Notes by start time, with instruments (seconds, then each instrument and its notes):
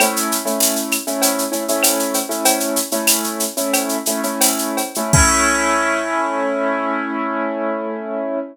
0.00 acoustic grand piano A3 C#4 E4, cowbell, claves, shaker
0.16 shaker
0.32 shaker
0.45 acoustic grand piano A3 C#4 E4, shaker
0.60 tambourine, shaker
0.76 shaker
0.91 claves, shaker
1.07 acoustic grand piano A3 C#4 E4, shaker
1.22 cowbell, shaker
1.39 shaker
1.52 acoustic grand piano A3 C#4 E4, shaker
1.68 acoustic grand piano A3 C#4 E4, shaker
1.83 tambourine, cowbell, claves, shaker
1.99 shaker
2.14 cowbell, shaker
2.29 acoustic grand piano A3 C#4 E4, shaker
2.45 cowbell, shaker
2.60 shaker
2.76 shaker
2.91 acoustic grand piano A3 C#4 E4, shaker
3.07 tambourine, claves, shaker
3.24 shaker
3.40 shaker
3.57 acoustic grand piano A3 C#4 E4, shaker
3.73 cowbell, claves, shaker
3.89 shaker
4.06 acoustic grand piano A3 C#4 E4, shaker
4.23 acoustic grand piano A3 C#4 E4, shaker
4.41 tambourine, cowbell, shaker
4.58 shaker
4.77 cowbell, shaker
4.95 acoustic grand piano A3 C#4 E4, shaker
5.13 acoustic grand piano A3 C#4 E4, kick, crash